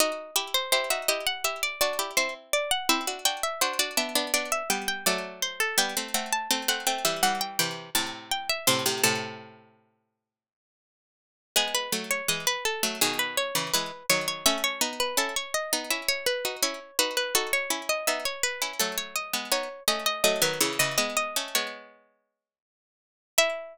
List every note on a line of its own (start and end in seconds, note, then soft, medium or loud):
0.00 0.31 D#4 loud
0.00 0.31 F#4 loud
0.00 0.35 D#5 medium
0.36 0.68 E4 loud
0.36 0.68 G4 loud
0.36 0.53 E5 medium
0.54 0.72 C5 medium
0.72 0.90 E4 medium
0.72 0.90 G4 loud
0.72 0.89 C5 medium
0.90 1.08 D#4 medium
0.90 1.08 F#4 medium
0.90 1.08 E5 medium
1.08 1.44 E4 loud
1.08 1.44 G4 loud
1.08 1.25 D#5 medium
1.27 1.44 F#5 medium
1.44 1.76 E4 medium
1.44 1.76 G4 medium
1.44 1.62 E5 medium
1.63 1.80 D5 medium
1.81 1.99 D4 medium
1.81 1.99 F#4 loud
1.81 2.12 D5 medium
1.99 2.16 E4 medium
1.99 2.16 G4 loud
2.17 2.82 C4 medium
2.17 2.82 E4 loud
2.17 2.34 C5 medium
2.53 2.70 D5 medium
2.71 2.88 F#5 medium
2.89 3.06 C4 loud
2.89 3.06 E4 loud
2.89 3.21 E5 medium
3.07 3.25 D4 medium
3.07 3.25 F#4 medium
3.25 3.55 D4 medium
3.25 3.55 F#4 loud
3.25 3.42 G5 medium
3.43 3.61 E5 medium
3.61 3.79 D4 medium
3.61 3.79 F#4 loud
3.61 3.78 C5 medium
3.79 3.96 D4 loud
3.79 3.96 F#4 loud
3.79 3.97 D5 medium
3.97 4.14 B3 medium
3.97 4.14 D4 loud
3.97 4.31 E5 medium
4.15 4.33 B3 loud
4.15 4.33 D4 loud
4.34 4.63 B3 medium
4.34 4.63 D4 loud
4.34 4.51 D5 medium
4.52 4.69 E5 medium
4.70 5.05 G3 medium
4.70 5.05 B3 loud
4.70 4.87 G5 medium
4.88 5.05 G5 medium
5.06 5.75 F#3 loud
5.06 5.75 A3 loud
5.06 5.39 D5 medium
5.42 5.59 C5 medium
5.60 5.77 A4 medium
5.78 5.95 G3 loud
5.78 5.95 B3 loud
5.78 6.14 G5 medium
5.97 6.14 A3 medium
5.97 6.14 C4 loud
6.14 6.48 A3 medium
6.14 6.48 C4 loud
6.14 6.31 F#5 medium
6.33 6.50 A5 medium
6.51 6.68 A3 medium
6.51 6.68 C4 loud
6.51 6.68 A5 medium
6.68 6.85 A3 medium
6.68 6.85 C4 loud
6.68 6.86 F#5 medium
6.87 7.04 A3 medium
6.87 7.04 C4 loud
6.87 7.04 G5 medium
7.05 7.22 E3 medium
7.05 7.22 G3 loud
7.05 7.22 E5 medium
7.23 7.58 E3 medium
7.23 7.58 G3 loud
7.23 7.40 F#5 medium
7.41 7.58 G5 medium
7.59 7.90 C3 medium
7.59 7.90 E3 loud
7.59 7.89 G5 medium
7.95 8.59 A2 medium
7.95 8.59 C3 loud
7.95 8.12 A5 medium
8.31 8.49 G5 medium
8.49 8.67 E5 medium
8.67 8.84 A2 loud
8.67 8.84 C3 loud
8.67 9.00 C5 medium
8.86 9.03 A2 medium
8.86 9.03 C3 loud
9.03 10.97 A2 loud
9.03 10.97 C3 loud
9.03 10.31 A4 medium
11.56 11.89 G#3 loud
11.56 11.89 B3 loud
11.56 11.74 G#4 medium
11.75 11.92 B4 medium
11.92 12.22 F#3 medium
11.92 12.22 A3 loud
12.11 12.28 C#5 medium
12.28 12.45 E3 medium
12.28 12.45 G#3 medium
12.28 12.46 D#5 medium
12.47 12.64 B4 medium
12.65 12.98 A4 medium
12.83 13.00 F#3 medium
12.83 13.00 A3 loud
13.01 13.52 B2 loud
13.01 13.52 D#3 loud
13.01 13.19 G#4 medium
13.19 13.36 B4 medium
13.37 13.70 C#5 medium
13.55 13.72 C#3 medium
13.55 13.72 E3 loud
13.73 13.92 E3 medium
13.73 13.92 G#3 loud
13.73 14.06 B4 medium
14.09 14.44 D#3 medium
14.09 14.44 F#3 loud
14.09 14.27 C#5 medium
14.28 14.45 C#5 medium
14.46 14.81 A3 loud
14.46 14.81 C#4 loud
14.46 14.63 E5 medium
14.64 14.81 C#5 medium
14.81 15.14 B3 loud
14.81 15.14 D#4 loud
15.00 15.17 B4 medium
15.17 15.34 C#4 medium
15.17 15.34 E4 medium
15.17 15.35 A4 medium
15.36 15.53 C#5 medium
15.54 15.87 D#5 medium
15.73 15.90 B3 loud
15.73 15.90 D#4 loud
15.91 16.35 C#4 medium
15.91 16.35 E4 medium
15.91 16.08 E5 medium
16.08 16.26 C#5 medium
16.26 16.56 B4 medium
16.45 16.62 D#4 medium
16.45 16.62 F#4 medium
16.63 16.80 C#4 medium
16.63 16.80 E4 loud
16.63 16.97 C#5 medium
16.99 17.32 D#4 medium
16.99 17.32 F#4 loud
16.99 17.16 B4 medium
17.17 17.34 B4 medium
17.35 17.67 D#4 loud
17.35 17.67 F#4 loud
17.35 17.52 A4 medium
17.53 17.70 C#5 medium
17.70 18.05 C#4 medium
17.70 18.05 E4 loud
17.89 18.06 D#5 medium
18.07 18.25 B3 medium
18.07 18.25 D#4 loud
18.07 18.24 E5 medium
18.25 18.42 C#5 medium
18.43 18.73 B4 medium
18.62 18.79 C#4 medium
18.62 18.79 E4 medium
18.80 19.33 F#3 medium
18.80 19.33 A3 loud
18.80 18.97 A4 medium
18.98 19.15 C#5 medium
19.16 19.50 D#5 medium
19.33 19.51 G#3 medium
19.33 19.51 B3 medium
19.52 19.69 B3 medium
19.52 19.69 D#4 loud
19.52 19.83 C#5 medium
19.88 20.22 A3 medium
19.88 20.22 C#4 loud
19.88 20.05 D#5 medium
20.06 20.23 D#5 medium
20.24 20.41 F#3 loud
20.24 20.41 A3 loud
20.24 20.41 D#5 medium
20.42 20.59 D#3 loud
20.42 20.59 F#3 loud
20.42 20.60 B4 medium
20.60 20.78 C#3 medium
20.60 20.78 E3 loud
20.60 20.78 C#5 medium
20.79 20.97 C#3 medium
20.79 20.97 E3 loud
20.79 20.97 D#5 medium
20.98 21.35 G#3 medium
20.98 21.35 B3 medium
20.98 21.16 D#5 medium
21.17 21.53 D#5 medium
21.36 21.55 A3 medium
21.36 21.55 C#4 loud
21.55 22.78 G#3 medium
21.55 22.78 B3 medium
21.55 23.20 C#5 medium
23.38 23.78 E4 loud
23.38 23.78 E5 loud